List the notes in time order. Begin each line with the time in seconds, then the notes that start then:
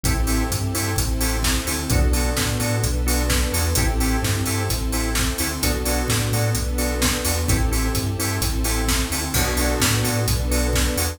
0.03 A1 C4 E4 G4 A4, kick, closed hi-hat
0.27 C4 E4 G4 A4, open hi-hat
0.50 G2, kick, closed hi-hat
0.74 G2 C4 E4 G4 A4, open hi-hat
0.96 A1 C4 E4 A4 C5, kick, closed hi-hat
1.21 C4 E4 G4 A4, open hi-hat
1.43 kick, snare
1.66 D2 C4 E4 G4 A4, open hi-hat
1.90 B1 B3 D4 F#4 A4, kick, closed hi-hat
2.13 B3 D4 F#4 A4, open hi-hat
2.37 A2, kick, snare
2.60 A2 B3 D4 F#4 A4, open hi-hat
2.83 B1 B3 D4 A4 B4, kick, closed hi-hat
3.06 B3 D4 F#4 A4, open hi-hat
3.30 kick, snare
3.52 E2 B3 D4 F#4 A4, open hi-hat
3.75 A1 C4 E4 G4 A4, kick, closed hi-hat
4.00 C4 E4 G4 A4, open hi-hat
4.22 G2, kick, snare
4.46 G2 C4 E4 G4 A4, open hi-hat
4.69 A1 C4 E4 A4 C5, kick, closed hi-hat
4.92 C4 E4 G4 A4, open hi-hat
5.15 kick, snare
5.38 D2 C4 E4 G4 A4, open hi-hat
5.62 B1 B3 D4 F#4 A4, kick, closed hi-hat
5.85 B3 D4 F#4 A4, open hi-hat
6.08 A2, kick, snare
6.32 A2 B3 D4 F#4 A4, open hi-hat
6.54 B1 B3 D4 A4 B4, kick, closed hi-hat
6.78 B3 D4 F#4 A4, open hi-hat
7.02 kick, snare
7.25 E2 B3 D4 F#4 A4, open hi-hat
7.48 A1 C4 E4 G4 A4, kick, closed hi-hat
7.71 C4 E4 G4 A4, open hi-hat
7.94 G2, kick, closed hi-hat
8.18 G2 C4 E4 G4 A4, open hi-hat
8.41 A1 C4 E4 A4 C5, kick, closed hi-hat
8.64 C4 E4 G4 A4, open hi-hat
8.88 kick, snare
9.11 D2 C4 E4 G4 A4, open hi-hat
9.34 B1 B3 D4 F#4 A4, kick, crash
9.57 B3 D4 F#4 A4, open hi-hat
9.80 A2, kick, snare
10.04 A2 B3 D4 F#4 A4, open hi-hat
10.27 B1 B3 D4 A4 B4, kick, closed hi-hat
10.51 B3 D4 F#4 A4, open hi-hat
10.73 kick, snare
10.97 E2 B3 D4 F#4 A4, open hi-hat